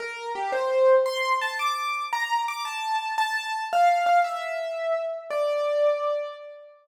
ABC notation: X:1
M:6/8
L:1/8
Q:3/8=113
K:Dm
V:1 name="Acoustic Grand Piano"
B2 G c3 | c'2 a d'3 | b2 d' a3 | a3 f2 f |
e5 z | d6 |]